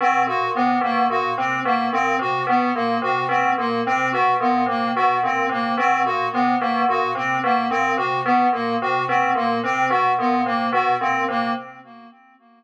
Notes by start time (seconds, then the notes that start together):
0.01 B2 C4
0.27 A#2 F#4
0.55 C3 B3
0.81 B2 A#3
1.10 A#2 F#4
1.38 C3 C4
1.65 B2 A#3
1.93 A#2 C4
2.19 C3 F#4
2.47 B2 B3
2.75 A#2 A#3
3.02 C3 F#4
3.29 B2 C4
3.58 A#2 A#3
3.86 C3 C4
4.12 B2 F#4
4.40 A#2 B3
4.66 C3 A#3
4.95 B2 F#4
5.23 A#2 C4
5.49 C3 A#3
5.78 B2 C4
6.05 A#2 F#4
6.33 C3 B3
6.60 B2 A#3
6.89 A#2 F#4
7.15 C3 C4
7.44 B2 A#3
7.70 A#2 C4
7.97 C3 F#4
8.25 B2 B3
8.53 A#2 A#3
8.82 C3 F#4
9.08 B2 C4
9.35 A#2 A#3
9.64 C3 C4
9.90 B2 F#4
10.19 A#2 B3
10.46 C3 A#3
10.72 B2 F#4
11.01 A#2 C4
11.28 C3 A#3